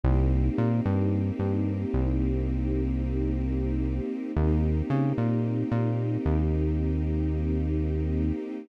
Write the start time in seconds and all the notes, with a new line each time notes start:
0.03 C2 A#3 C4 D#4 G4
0.58 A#2
0.85 G2
1.39 G2
1.94 C2
4.36 D#2 A#3 C4 D#4 G4
4.90 C#3
5.18 A#2
5.72 A#2
6.26 D#2